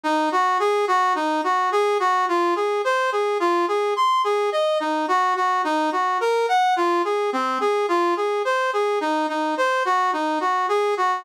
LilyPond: \new Staff { \time 4/4 \key des \major \tempo 4 = 107 ees'8 ges'8 aes'8 ges'8 ees'8 ges'8 aes'8 ges'8 | f'8 aes'8 c''8 aes'8 f'8 aes'8 c'''8 aes'8 | ees''8 ees'8 ges'8 ges'8 ees'8 ges'8 bes'8 ges''8 | f'8 aes'8 c'8 aes'8 f'8 aes'8 c''8 aes'8 |
ees'8 ees'8 c''8 ges'8 ees'8 ges'8 aes'8 ges'8 | }